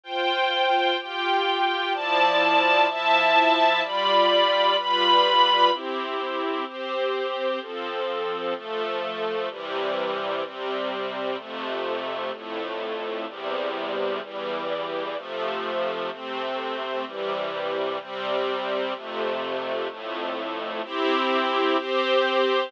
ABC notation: X:1
M:4/4
L:1/8
Q:1/4=127
K:C
V:1 name="String Ensemble 1"
[Fcg]4 [FGg]4 | [F,Eda]4 [F,Eea]4 | [G,Fdb]4 [G,FBb]4 | [CEG]4 [CGc]4 |
[F,CA]4 [F,A,A]4 | [C,E,G,]4 [C,G,C]4 | [F,,C,A,]4 [F,,A,,A,]4 | [E,,C,G,]4 [E,,E,G,]4 |
[C,F,A,]4 [C,A,C]4 | [C,E,G,]4 [C,G,C]4 | [F,,C,A,]4 [F,,A,,A,]4 | [CEG]4 [CGc]4 |]